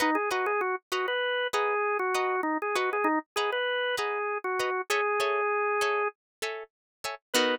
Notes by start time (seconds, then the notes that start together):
0.00 D#4 B4 D#5 F#5 A#5
0.15 G#4
0.31 F#4 B4 D#5 F#5 A#5
0.46 G#4
0.61 F#4
0.92 F#4 B4 D#5 F#5 A#5
1.08 B4
1.53 G#4 B4 D#5 F#5 A#5
1.99 F#4
2.14 B4 D#5 F#5 A#5
2.43 D#4
2.62 G#4
2.75 F#4 B4 D#5 F#5 A#5
2.93 G#4
3.04 D#4
3.36 G#4 B4 D#5 F#5 A#5
3.52 B4
3.97 G#4 B4 D#5 F#5 A#5
4.44 F#4
4.59 B4 D#5 F#5 A#5
4.90 G#4 A4 C#5 E5 G#5
5.20 A4 C#5 E5 G#5
5.81 A4 C#5 E5 G#5
6.42 A4 C#5 E5 G#5
7.04 A4 C#5 E5 G#5
7.34 B3 D#4 F#4 A#4 B4